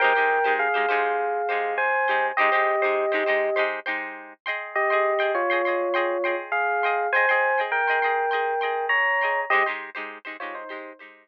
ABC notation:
X:1
M:4/4
L:1/16
Q:1/4=101
K:Abmix
V:1 name="Electric Piano 1"
[B=g]4 [Af]8 [ca]4 | [=Ge]10 z6 | [=Ge]4 [Fd]8 [Af]4 | [ca]4 [B=g]8 [db]4 |
[=Ge] z5 [Fd] [Ec]3 z6 |]
V:2 name="Pizzicato Strings"
[A,E=Gc] [A,EGc]2 [A,EGc]2 [A,EGc] [A,EGc]4 [A,EGc]4 [A,EGc]2 | [A,E=Gc] [A,EGc]2 [A,EGc]2 [A,EGc] [A,EGc]2 [A,EGc]2 [A,EGc]4 [Ae=gc']2- | [Ae=gc'] [Aegc']2 [Aegc']2 [Aegc'] [Aegc']2 [Aegc']2 [Aegc']4 [Aegc']2 | [Ae=gc'] [Aegc']2 [Aegc']2 [Aegc'] [Aegc']2 [Aegc']2 [Aegc']4 [Aegc']2 |
[A,E=Gc] [A,EGc]2 [A,EGc]2 [A,EGc] [A,EGc]2 [A,EGc]2 [A,EGc]4 z2 |]